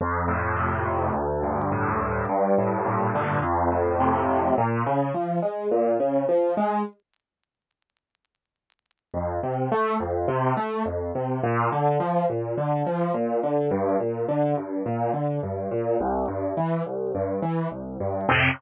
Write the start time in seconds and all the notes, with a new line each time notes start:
0.01 F2
0.28 A2
0.56 C3
0.86 A2
1.13 D2
1.43 G2
1.71 A2
2.00 G2
2.29 G2
2.58 A2
2.86 A#2
3.15 D3
3.42 F2
3.71 A2
4.00 C3
4.29 A2
4.58 A#2
4.86 C#3
5.14 F3
5.42 G#3
5.71 A#2
6.00 C#3
6.29 F3
6.57 G#3
9.14 F2
9.43 C3
9.72 A3
10.00 F2
10.28 C3
10.57 A3
10.85 F2
11.15 C3
11.43 A#2
11.72 D3
12.00 F3
12.30 A#2
12.57 D3
12.86 F3
13.14 A#2
13.43 D3
13.71 G2
14.00 A#2
14.28 D3
14.57 G2
14.86 A#2
15.13 D3
15.43 G2
15.71 A#2
16.00 C2
16.28 G2
16.57 E3
16.86 C2
17.15 G2
17.42 E3
17.71 C2
18.00 G2
18.29 F2 A2 C3